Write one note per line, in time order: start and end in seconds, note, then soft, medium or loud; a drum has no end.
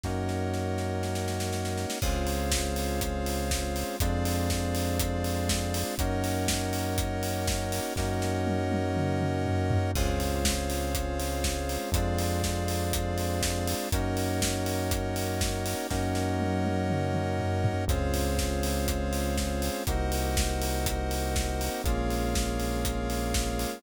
0.04 1.86 F#2 medium
0.04 1.98 A#3 medium
0.04 1.98 C#4 medium
0.04 1.98 D#4 medium
0.04 1.98 F#4 medium
0.04 1.99 A#4 medium
0.04 1.99 C#5 medium
0.04 1.99 D#5 medium
0.04 1.99 F#5 medium
0.04 kick medium
0.04 snare medium
0.29 snare medium
0.54 snare medium
0.78 snare medium
1.03 snare medium
1.15 snare medium
1.28 snare medium
1.40 snare medium
1.53 snare medium
1.65 snare medium
1.77 snare medium
1.90 snare loud
2.02 3.84 C#2 medium
2.02 3.97 G#3 medium
2.02 3.97 C4 medium
2.02 3.97 C#4 medium
2.02 3.97 F4 medium
2.02 3.96 G#4 medium
2.02 3.96 C5 loud
2.02 3.96 C#5 loud
2.02 3.96 F5 loud
2.02 kick loud
2.02 crash loud
2.27 open hi-hat medium
2.52 kick medium
2.52 snare loud
2.76 open hi-hat medium
3.01 kick loud
3.01 closed hi-hat loud
3.26 open hi-hat medium
3.51 kick medium
3.51 snare loud
3.76 open hi-hat medium
4.00 5.84 F2 medium
4.00 5.95 G#3 medium
4.00 5.95 C4 medium
4.00 5.95 D4 medium
4.00 5.95 F4 medium
4.00 5.95 G#4 loud
4.00 5.95 C5 medium
4.00 5.95 D5 loud
4.00 5.95 F5 medium
4.00 kick loud
4.00 closed hi-hat loud
4.25 open hi-hat medium
4.50 kick medium
4.50 snare loud
4.75 open hi-hat medium
4.99 kick loud
4.99 closed hi-hat loud
5.24 open hi-hat medium
5.49 kick medium
5.49 snare loud
5.74 open hi-hat loud
5.98 7.80 F#2 medium
5.98 7.93 A#3 medium
5.98 7.93 C#4 medium
5.98 7.93 D#4 medium
5.98 7.93 F#4 medium
5.98 7.93 A#4 loud
5.98 7.93 C#5 loud
5.98 7.93 D#5 loud
5.98 7.93 F#5 medium
5.98 kick loud
5.98 closed hi-hat loud
6.24 open hi-hat medium
6.48 kick medium
6.48 snare loud
6.73 open hi-hat medium
6.98 kick loud
6.98 closed hi-hat loud
7.23 open hi-hat medium
7.47 kick loud
7.47 snare loud
7.72 open hi-hat medium
7.96 9.78 F#2 medium
7.96 9.92 A#3 medium
7.96 9.92 C#4 medium
7.96 9.92 D#4 medium
7.96 9.92 F#4 medium
7.96 9.91 A#4 medium
7.96 9.91 C#5 loud
7.96 9.91 D#5 loud
7.96 9.91 F#5 loud
7.96 kick medium
7.96 snare medium
8.22 snare medium
8.47 high tom medium
8.71 high tom loud
8.96 mid tom loud
9.21 mid tom loud
9.46 floor tom loud
9.71 floor tom loud
9.95 11.78 C#2 medium
9.95 11.90 G#3 medium
9.95 11.90 C4 medium
9.95 11.90 C#4 medium
9.95 11.90 F4 medium
9.95 11.90 G#4 medium
9.95 11.90 C5 loud
9.95 11.90 C#5 loud
9.95 11.90 F5 loud
9.95 kick loud
9.95 crash loud
10.20 open hi-hat medium
10.45 kick medium
10.45 snare loud
10.70 open hi-hat medium
10.95 kick loud
10.95 closed hi-hat loud
11.20 open hi-hat medium
11.44 kick medium
11.44 snare loud
11.69 open hi-hat medium
11.92 13.74 F2 medium
11.92 13.88 G#3 medium
11.92 13.88 C4 medium
11.92 13.88 D4 medium
11.92 13.88 F4 medium
11.92 13.89 G#4 loud
11.92 13.89 C5 medium
11.92 13.89 D5 loud
11.92 13.89 F5 medium
11.92 kick loud
11.92 closed hi-hat loud
12.18 open hi-hat medium
12.43 kick medium
12.43 snare loud
12.68 open hi-hat medium
12.93 kick loud
12.93 closed hi-hat loud
13.18 open hi-hat medium
13.42 kick medium
13.42 snare loud
13.67 open hi-hat loud
13.92 15.75 F#2 medium
13.92 15.87 A#3 medium
13.92 15.87 C#4 medium
13.92 15.87 D#4 medium
13.92 15.87 F#4 medium
13.92 15.87 A#4 loud
13.92 15.87 C#5 loud
13.92 15.87 D#5 loud
13.92 15.87 F#5 medium
13.92 kick loud
13.92 closed hi-hat loud
14.17 open hi-hat medium
14.42 kick medium
14.42 snare loud
14.66 open hi-hat medium
14.91 kick loud
14.91 closed hi-hat loud
15.16 open hi-hat medium
15.41 kick loud
15.41 snare loud
15.66 open hi-hat medium
15.90 17.73 F#2 medium
15.90 17.84 A#3 medium
15.90 17.84 C#4 medium
15.90 17.84 D#4 medium
15.90 17.84 F#4 medium
15.90 17.85 A#4 medium
15.90 17.85 C#5 loud
15.90 17.85 D#5 loud
15.90 17.85 F#5 loud
15.90 kick medium
15.90 snare medium
16.15 snare medium
16.40 high tom medium
16.65 high tom loud
16.90 mid tom loud
17.14 mid tom loud
17.39 floor tom loud
17.64 floor tom loud
17.88 19.70 C#2 medium
17.88 19.83 G#3 medium
17.88 19.83 C4 medium
17.88 19.83 C#4 medium
17.88 19.83 F4 medium
17.88 19.83 G#4 loud
17.88 19.83 C5 loud
17.88 19.83 C#5 loud
17.88 19.83 F5 medium
17.88 kick loud
17.88 closed hi-hat loud
18.14 open hi-hat medium
18.39 kick medium
18.39 snare loud
18.63 open hi-hat loud
18.88 kick loud
18.88 closed hi-hat loud
19.13 open hi-hat medium
19.38 kick medium
19.38 snare loud
19.62 open hi-hat medium
19.87 21.70 C2 medium
19.87 21.82 A#3 medium
19.87 21.82 C4 medium
19.87 21.82 D#4 medium
19.87 21.82 F#4 medium
19.87 21.82 A#4 loud
19.87 21.82 C5 loud
19.87 21.82 D#5 medium
19.87 21.82 F#5 loud
19.87 kick loud
19.87 closed hi-hat loud
20.12 open hi-hat medium
20.37 kick loud
20.37 snare loud
20.62 open hi-hat loud
20.86 kick loud
20.86 closed hi-hat loud
21.11 open hi-hat medium
21.36 kick loud
21.36 snare loud
21.61 open hi-hat medium
21.84 23.67 A#1 medium
21.84 23.80 G#3 medium
21.84 23.80 A#3 loud
21.84 23.80 C#4 medium
21.84 23.80 F4 medium
21.84 23.79 G#4 loud
21.84 23.79 A#4 loud
21.84 23.79 C#5 loud
21.84 23.79 F5 loud
21.84 kick loud
21.84 closed hi-hat loud
22.10 open hi-hat medium
22.35 kick loud
22.35 snare loud
22.60 open hi-hat medium
22.85 kick medium
22.85 closed hi-hat loud
23.10 open hi-hat medium
23.34 kick loud
23.34 snare loud
23.59 open hi-hat medium